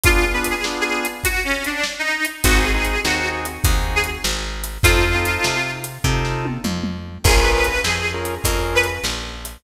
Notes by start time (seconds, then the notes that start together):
0.04 B3 D4 F4 G#4, kick, closed hi-hat
0.33 B3 D4 F4 G#4 B4
0.44 closed hi-hat
0.50 G#4
0.64 B3 D4 F4 G#4, snare
0.81 G#4
1.05 closed hi-hat
1.24 F#4, kick, closed hi-hat
1.44 C#4
1.64 D4, closed hi-hat
1.83 snare
1.99 D#4
2.25 closed hi-hat
2.44 G#1 C4 D#4 F#4 G#4, kick, closed hi-hat
2.58 G#4
2.73 C4 D#4 F#4 G#4
2.85 closed hi-hat
3.04 D#2 C4 D#4 F#4 G#4, snare
3.45 closed hi-hat
3.64 D#2 C4 D#4 F#4 G#4, kick, closed hi-hat
3.95 G#4
4.04 closed hi-hat
4.24 G#1, snare
4.64 closed hi-hat
4.83 F2 C4 D#4 F4 A4, kick, closed hi-hat
5.14 C4 D#4 F4 A4
5.25 closed hi-hat
5.44 C3, snare
5.84 closed hi-hat
6.04 C3 C4 D#4 F4 A4, kick
6.25 snare
6.45 high tom
6.64 F2, mid tom
6.83 mid tom
7.24 A#1 C#4 F4 G#4 A#4, kick, crash
7.39 B4
7.53 B4
7.64 closed hi-hat
7.84 F2 G#4, snare
8.14 C#4 F4 G#4 A#4
8.25 closed hi-hat
8.44 F2 C#4 F4 G#4 A#4, kick, closed hi-hat
8.75 B4
8.83 closed hi-hat
9.04 A#1, snare
9.45 closed hi-hat